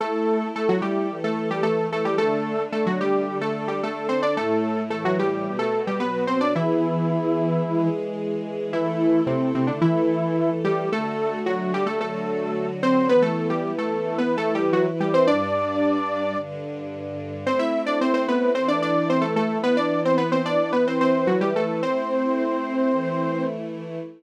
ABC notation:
X:1
M:4/4
L:1/16
Q:1/4=110
K:Ador
V:1 name="Lead 2 (sawtooth)"
[A,A]4 [A,A] [F,F] [G,G]3 [A,A]2 [G,G] [A,A]2 [A,A] [G,G] | [A,A]4 [A,A] [F,F] [G,G]3 [A,A]2 [G,G] [A,A]2 [Cc] [Dd] | [A,A]4 [A,A] [F,F] [G,G]3 [A,A]2 [G,G] [B,B]2 [Cc] [Dd] | [E,E]10 z6 |
[E,E]4 [C,C]2 [C,C] [D,D] [E,E]6 [G,G]2 | [A,A]4 [F,F]2 [G,G] [A,A] [A,A]6 [Cc]2 | [B,B] [A,A]2 [G,G]2 [A,A]3 (3[B,B]2 [A,A]2 [G,G]2 [F,F] z [G,G] [Cc] | [Dd]10 z6 |
[Cc] [Ee]2 [Dd] [Cc] [Cc] [B,B]2 [Cc] [Dd] [Dd]2 [Cc] [A,A] [A,A]2 | [B,B] [Dd]2 [Cc] [B,B] [Cc] [Dd]2 [B,B] [Cc] [Cc]2 [F,F] [G,G] [A,A]2 | [Cc]14 z2 |]
V:2 name="String Ensemble 1"
[A,EA]8 [E,A,A]8 | [D,A,D]8 [D,DA]8 | [A,,A,E]4 [A,,E,E]4 [B,,B,F]4 [B,,F,F]4 | [E,B,^G]8 [E,^G,G]8 |
[A,EA]8 [E,A,A]8 | [D,A,F]8 [D,F,F]8 | [E,B,E]8 [E,EB]8 | [G,,G,D]8 [G,,D,D]8 |
[A,CE]8 [E,A,E]8 | [E,B,E]8 [E,EB]8 | [A,CE]8 [E,A,E]8 |]